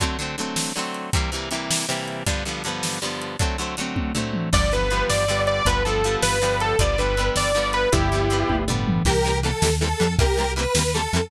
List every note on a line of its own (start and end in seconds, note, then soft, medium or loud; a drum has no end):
0.00 0.17 D3 medium
0.00 0.17 F#3 medium
0.00 0.17 A3 medium
0.00 0.17 C4 loud
0.00 kick medium
0.00 closed hi-hat medium
0.19 0.36 D3 medium
0.19 0.36 F#3 medium
0.19 0.36 A3 medium
0.19 0.36 C4 medium
0.38 0.72 D3 medium
0.38 0.72 F#3 medium
0.38 0.72 A3 medium
0.38 0.72 C4 medium
0.38 closed hi-hat medium
0.56 snare loud
0.76 1.10 D3 medium
0.76 1.10 F#3 medium
0.76 1.10 A3 medium
0.76 1.10 C4 medium
0.94 closed hi-hat medium
1.13 1.31 C3 medium
1.13 1.31 E3 medium
1.13 1.31 G3 medium
1.13 1.31 A#3 loud
1.13 kick loud
1.13 closed hi-hat loud
1.32 1.49 C3 medium
1.32 1.49 E3 medium
1.32 1.49 G3 medium
1.32 1.49 A#3 medium
1.51 1.86 C3 medium
1.51 1.86 E3 medium
1.51 1.86 G3 medium
1.51 1.86 A#3 medium
1.51 closed hi-hat medium
1.71 snare loud
1.89 2.23 C3 medium
1.89 2.23 E3 medium
1.89 2.23 G3 medium
1.89 2.23 A#3 medium
2.08 closed hi-hat medium
2.26 2.44 G2 loud
2.26 2.44 D3 medium
2.26 2.44 F3 medium
2.26 2.44 B3 medium
2.26 kick medium
2.26 closed hi-hat medium
2.45 2.63 G2 medium
2.45 2.63 D3 medium
2.45 2.63 F3 medium
2.45 2.63 B3 medium
2.64 2.99 G2 medium
2.64 2.99 D3 medium
2.64 2.99 F3 medium
2.64 closed hi-hat medium
2.68 2.99 B3 medium
2.83 snare medium
3.02 3.37 G2 medium
3.02 3.37 D3 medium
3.02 3.37 F3 medium
3.02 3.37 B3 medium
3.21 closed hi-hat medium
3.39 3.57 D3 medium
3.39 3.57 F#3 medium
3.39 3.57 A3 medium
3.39 3.57 C4 medium
3.39 kick loud
3.39 closed hi-hat medium
3.58 3.76 D3 medium
3.58 3.76 F#3 medium
3.58 3.76 A3 medium
3.58 3.76 C4 medium
3.77 4.12 D3 medium
3.77 4.12 F#3 medium
3.77 4.12 A3 medium
3.77 closed hi-hat medium
3.81 4.12 C4 medium
3.96 kick medium
3.96 high tom medium
4.15 4.49 D3 medium
4.15 4.49 F#3 medium
4.15 4.49 A3 medium
4.15 4.49 C4 medium
4.15 floor tom medium
4.34 mid tom medium
4.53 5.04 G1 loud
4.53 4.70 D3 loud
4.53 4.70 F3 loud
4.53 4.70 G3 loud
4.53 4.70 B3 loud
4.53 4.71 D5 loud
4.53 kick loud
4.53 crash loud
4.72 4.89 D3 medium
4.72 4.89 F3 medium
4.72 4.89 G3 medium
4.72 4.89 B3 medium
4.72 5.04 B4 loud
4.90 5.25 D3 medium
4.90 5.25 F3 medium
4.90 5.25 G3 medium
4.90 5.25 B3 medium
4.90 closed hi-hat medium
5.09 5.61 G1 medium
5.09 5.41 D5 medium
5.09 snare loud
5.28 5.63 D3 medium
5.28 5.63 F3 medium
5.28 5.63 G3 medium
5.28 5.63 B3 medium
5.47 5.65 D5 medium
5.47 closed hi-hat medium
5.65 6.17 G1 loud
5.65 5.83 D3 medium
5.65 5.83 F3 loud
5.65 5.83 G3 loud
5.65 5.83 B3 loud
5.65 5.83 B4 loud
5.65 kick medium
5.65 closed hi-hat loud
5.84 6.02 D3 medium
5.84 6.02 F3 medium
5.84 6.02 G3 medium
5.84 6.02 B3 medium
5.84 6.15 A4 medium
6.04 6.39 D3 medium
6.04 6.39 F3 medium
6.04 6.39 G3 medium
6.04 6.39 B3 medium
6.04 closed hi-hat medium
6.22 6.74 G1 medium
6.22 6.57 B4 medium
6.22 snare loud
6.42 6.76 D3 medium
6.42 6.76 F3 medium
6.42 6.76 G3 medium
6.42 6.76 B3 medium
6.60 6.78 A4 medium
6.60 closed hi-hat medium
6.79 7.30 G1 loud
6.79 6.97 D3 medium
6.79 6.97 F3 medium
6.79 6.97 G3 loud
6.79 6.97 B3 loud
6.79 6.98 D5 medium
6.79 kick loud
6.79 closed hi-hat loud
6.98 7.15 D3 medium
6.98 7.15 F3 medium
6.98 7.15 G3 medium
6.98 7.15 B3 medium
6.98 7.30 B4 medium
7.17 7.52 D3 medium
7.17 7.52 F3 medium
7.17 7.52 G3 medium
7.17 7.52 B3 loud
7.17 closed hi-hat medium
7.35 7.86 G1 medium
7.35 7.67 D5 medium
7.35 snare loud
7.55 7.89 D3 medium
7.55 7.89 F3 medium
7.55 7.89 G3 medium
7.55 7.89 B3 medium
7.73 7.89 B4 medium
7.73 closed hi-hat medium
7.92 8.44 G1 loud
7.92 8.10 D3 loud
7.92 8.10 F3 loud
7.92 8.10 G3 loud
7.92 8.10 B3 medium
7.92 8.55 E4 medium
7.92 8.55 G4 loud
7.92 kick loud
7.92 closed hi-hat loud
8.12 8.29 D3 medium
8.12 8.29 F3 medium
8.12 8.29 G3 medium
8.12 8.29 B3 medium
8.30 8.65 D3 medium
8.30 8.65 F3 medium
8.30 8.65 G3 medium
8.30 8.65 B3 medium
8.30 closed hi-hat medium
8.49 9.00 G1 medium
8.49 kick medium
8.49 high tom medium
8.68 9.03 D3 medium
8.68 9.03 F3 medium
8.68 9.03 G3 medium
8.68 9.03 B3 medium
8.68 floor tom medium
8.87 mid tom loud
9.05 9.53 C2 loud
9.05 9.13 E3 medium
9.05 9.13 G3 medium
9.05 9.13 A#3 medium
9.05 9.13 C4 medium
9.05 9.38 G4 medium
9.05 9.38 A#4 medium
9.05 kick medium
9.05 crash loud
9.24 9.32 E3 medium
9.24 9.32 G3 medium
9.24 9.32 A#3 medium
9.24 9.32 C4 medium
9.43 9.51 E3 medium
9.43 9.51 G3 medium
9.43 9.51 A#3 medium
9.43 9.51 C4 medium
9.43 9.74 A4 medium
9.43 ride medium
9.62 9.94 D#2 medium
9.62 9.70 E3 medium
9.62 9.70 G3 medium
9.62 9.70 A#3 medium
9.62 9.70 C4 medium
9.62 snare loud
9.80 9.89 E3 medium
9.80 9.89 G3 medium
9.80 9.89 A#3 medium
9.80 9.89 C4 medium
9.80 10.14 A4 medium
10.00 10.16 F2 medium
10.00 10.07 E3 medium
10.00 10.07 G3 medium
10.00 10.07 A#3 medium
10.00 10.07 C4 medium
10.00 ride medium
10.18 10.67 C2 loud
10.18 10.26 E3 medium
10.18 10.26 G3 medium
10.18 10.26 A#3 medium
10.18 10.26 C4 medium
10.18 10.52 G4 medium
10.18 10.52 A#4 medium
10.18 kick loud
10.18 ride loud
10.37 10.45 E3 medium
10.37 10.45 G3 medium
10.37 10.45 A#3 medium
10.37 10.45 C4 medium
10.56 10.64 E3 medium
10.56 10.64 G3 medium
10.56 10.64 A#3 medium
10.56 10.64 C4 medium
10.56 10.93 B4 medium
10.56 ride medium
10.75 11.07 D#2 medium
10.75 10.83 E3 medium
10.75 10.83 G3 medium
10.75 10.83 A#3 medium
10.75 10.83 C4 medium
10.75 snare loud
10.94 11.02 E3 medium
10.94 11.02 G3 medium
10.94 11.02 A#3 medium
10.94 11.02 C4 medium
10.94 11.29 A4 medium
11.13 11.29 F2 medium
11.13 11.21 E3 medium
11.13 11.21 G3 medium
11.13 11.21 A#3 medium
11.13 11.21 C4 medium
11.13 ride medium